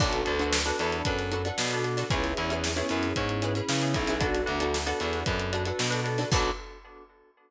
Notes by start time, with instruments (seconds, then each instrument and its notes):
0.00 electric bass (finger) B1, electric piano 2 B3 D4 F#4 A4, pizzicato strings D4 F#4 A4 B4, kick, crash
0.13 closed hi-hat
0.25 electric bass (finger) D2, electric piano 2 B3 D4 F#4 A4, closed hi-hat
0.39 pizzicato strings D4 F#4 A4 B4, closed hi-hat
0.53 snare
0.65 electric piano 2 B3 D4 F#4 A4, pizzicato strings D4 F#4 A4 B4, closed hi-hat
0.79 electric bass (finger) E2, pizzicato strings D4 F#4 A4 B4, closed hi-hat
0.92 closed hi-hat
1.05 electric bass (finger) F#2, electric piano 2 B3 D4 F#4 A4, kick, closed hi-hat
1.18 snare, closed hi-hat
1.31 pizzicato strings D4 F#4 A4 B4, closed hi-hat
1.45 pizzicato strings D4 F#4 A4 B4, closed hi-hat
1.58 electric bass (finger) B2, snare
1.71 electric piano 2 B3 D4 F#4 A4, snare, closed hi-hat
1.84 electric piano 2 B3 D4 F#4 A4, closed hi-hat
1.97 pizzicato strings D4 F#4 A4 B4, snare, closed hi-hat
2.10 electric bass (finger) C#2, electric piano 2 B3 C#4 E4 G#4, pizzicato strings C#4 E4 G#4 B4, kick, closed hi-hat
2.24 snare, closed hi-hat
2.37 electric bass (finger) E2, electric piano 2 B3 C#4 E4 G#4, closed hi-hat
2.50 pizzicato strings C#4 E4 G#4 B4, closed hi-hat
2.64 snare
2.76 electric piano 2 B3 C#4 E4 G#4, pizzicato strings C#4 E4 G#4 B4, closed hi-hat
2.89 electric bass (finger) F#2, pizzicato strings C#4 E4 G#4 B4, closed hi-hat
3.03 snare, closed hi-hat
3.16 electric bass (finger) G#2, electric piano 2 B3 C#4 E4 G#4, kick, closed hi-hat
3.29 closed hi-hat
3.42 pizzicato strings C#4 E4 G#4 B4, closed hi-hat
3.55 pizzicato strings C#4 E4 G#4 B4, closed hi-hat
3.69 electric bass (finger) C#3, snare
3.82 electric piano 2 B3 C#4 E4 G#4, closed hi-hat
3.94 electric bass (finger) B1, electric piano 2 B3 C#4 E4 G#4, kick, closed hi-hat
4.07 pizzicato strings C#4 E4 G#4 B4, snare, closed hi-hat
4.20 electric piano 2 B3 D4 F#4 A4, pizzicato strings D4 F#4 A4 B4, kick, closed hi-hat
4.34 snare, closed hi-hat
4.46 electric bass (finger) D2, electric piano 2 B3 D4 F#4 A4, closed hi-hat
4.60 pizzicato strings D4 F#4 A4 B4, closed hi-hat
4.74 snare
4.86 electric piano 2 B3 D4 F#4 A4, pizzicato strings D4 F#4 A4 B4, closed hi-hat
5.00 electric bass (finger) E2, pizzicato strings D4 F#4 A4 B4, closed hi-hat
5.13 snare, closed hi-hat
5.26 electric bass (finger) F#2, electric piano 2 B3 D4 F#4 A4, kick, closed hi-hat
5.39 closed hi-hat
5.53 pizzicato strings D4 F#4 A4 B4, closed hi-hat
5.65 pizzicato strings D4 F#4 A4 B4, closed hi-hat
5.79 electric bass (finger) B2, snare
5.90 electric piano 2 B3 D4 F#4 A4, closed hi-hat
6.04 electric piano 2 B3 D4 F#4 A4, snare, closed hi-hat
6.18 pizzicato strings D4 F#4 A4 B4, snare, closed hi-hat
6.32 electric bass (finger) B1, electric piano 2 B3 D4 F#4 A4, pizzicato strings D4 F#4 A4 B4, kick, crash